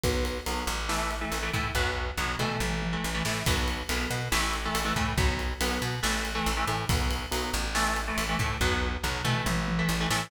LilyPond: <<
  \new Staff \with { instrumentName = "Overdriven Guitar" } { \time 4/4 \key b \phrygian \tempo 4 = 140 <fis b>4 <fis b>4 <e a>8. <e a>8 <e a>16 <e a>8 | <fis b>4 <fis b>8 <e a>4~ <e a>16 <e a>8 <e a>16 <e a>8 | <fis b>4 <fis b>4 <e a>8. <e a>8 <e a>16 <e a>8 | <fis b>4 <fis b>4 <e a>8. <e a>8 <e a>16 <e a>8 |
<fis b>4 <fis b>4 <e a>8. <e a>8 <e a>16 <e a>8 | <fis b>4 <fis b>8 <e a>4~ <e a>16 <e a>8 <e a>16 <e a>8 | }
  \new Staff \with { instrumentName = "Electric Bass (finger)" } { \clef bass \time 4/4 \key b \phrygian b,,4 b,,8 a,,4. a,,8 a,8 | b,,4 b,,8 b,8 a,,4 a,,8 a,8 | b,,4 b,,8 b,8 a,,4 a,,8 a,8 | b,,4 b,,8 b,8 a,,4 a,,8 a,8 |
b,,4 b,,8 a,,4. a,,8 a,8 | b,,4 b,,8 b,8 a,,4 a,,8 a,8 | }
  \new DrumStaff \with { instrumentName = "Drums" } \drummode { \time 4/4 <bd cymr>8 cymr8 cymr8 cymr8 sn8 cymr8 cymr8 <bd cymr>8 | <bd tomfh>4 toml8 toml8 tommh8 tommh8 r8 sn8 | <bd cymr>8 cymr8 cymr8 cymr8 sn8 cymr8 cymr8 bd8 | <bd cymr>8 cymr8 cymr8 cymr8 sn8 cymr8 cymr8 cymr8 |
<bd cymr>8 cymr8 cymr8 cymr8 sn8 cymr8 cymr8 <bd cymr>8 | <bd tomfh>4 toml8 toml8 tommh8 tommh8 r8 sn8 | }
>>